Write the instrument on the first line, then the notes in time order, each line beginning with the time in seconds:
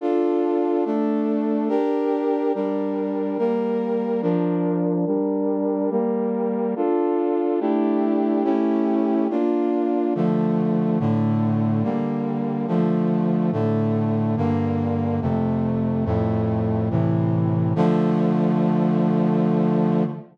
brass section
0.01 D4 F4 A4
0.85 A3 D4 A4
1.69 D4 G4 A#4
2.55 G3 D4 A#4
3.38 G3 A#3 A#4
4.22 F3 D4 A#4
5.06 G3 D4 A#4
5.90 G3 A#3 A#4
6.76 D4 F4 A4
7.60 A3 D4 E4 G4
8.44 A3 C#4 E4 G4
9.30 A#3 D4 F4
10.15 D3 F3 A3
11.00 A2 D3 A3
11.83 D3 G3 A#3
12.67 D3 F3 A3
13.52 A2 D3 A3
14.37 G2 D3 A#3
15.21 F2 C3 A3
16.05 F2 A2 A3
16.90 A2 C3 E3
17.76 D3 F3 A3